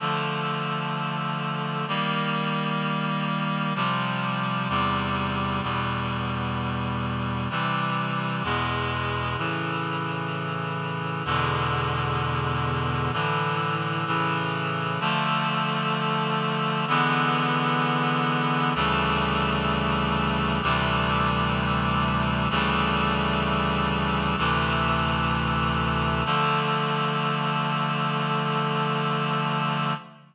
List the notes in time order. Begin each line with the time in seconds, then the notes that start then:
0.00 D3 F3 A3
1.88 D#3 G3 A#3
3.75 C3 F3 G3
4.69 E2 C3 G3
5.62 E2 B2 G3
7.50 C3 E3 G3
8.44 E2 B2 G#3
9.38 A2 C#3 E3
11.25 E2 B2 D3 G#3
13.12 A2 D3 E3
14.06 A2 C#3 E3
15.00 D3 F3 A3
16.88 D3 E3 G#3 B3
18.75 D2 C#3 E3 G3 A3
20.62 D2 C3 E3 G3 A3
22.50 D2 C#3 E3 G3 A3
24.38 D2 C3 E3 A3
26.25 D3 F3 A3